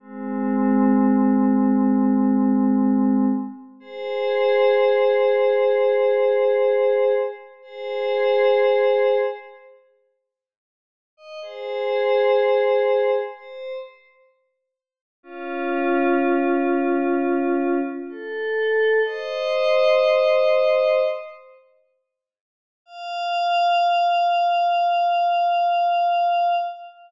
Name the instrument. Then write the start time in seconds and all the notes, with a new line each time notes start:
pad 5 (bowed)
0.00 G#3 C4
3.80 G#4 C5
7.62 G#4 C5
11.17 D#5
11.42 G#4 C5
13.33 C5
15.23 C#4 F4
18.09 A4
19.05 C5 D#5
22.86 F5